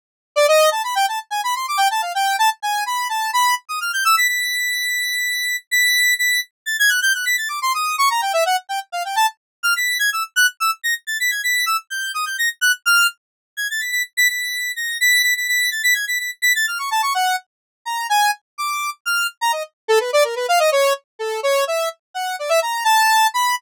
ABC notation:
X:1
M:9/8
L:1/16
Q:3/8=84
K:none
V:1 name="Lead 1 (square)"
z3 d ^d2 a b g a z ^g b c' =d' =g a f | g2 a z ^g2 b2 a2 b2 z ^d' f' =g' e' b' | b'12 b'4 b'2 | z2 a' ^g' ^f' =g' f' b' a' d' c' ^d'2 ^c' ^a g e ^f |
z g z f g a z3 f' b'2 ^g' e' z ^f' z e' | z ^a' z =a' b' ^g' b'2 e' z =g'2 ^d' g' ^a' z ^f' z | f'2 z4 ^g' a' b' b' z b' b'4 ^a'2 | b'2 b' b' b'2 a' b' ^g' b' b' z b' a' f' ^c' a c' |
^f2 z4 ^a2 ^g2 z2 d'3 z =f'2 | z ^a ^d z2 =A B =d ^A B f ^d ^c2 z2 =A2 | ^c2 e2 z2 ^f2 d e ^a2 =a4 b2 |]